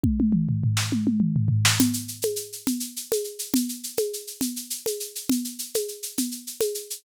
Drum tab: SH |------------|xxxxxxxxxxxx|xxxxxxxxxxxx|xxxxxxxxxxxx|
SD |-----o-----o|------------|------------|------------|
T1 |oo----oo----|------------|------------|------------|
T2 |--o-----o---|------------|------------|------------|
FT |---oo----oo-|------------|------------|------------|
CG |------------|O--o--O--o--|O--o--O--o--|O--o--O--o--|
BD |o-----------|------------|------------|------------|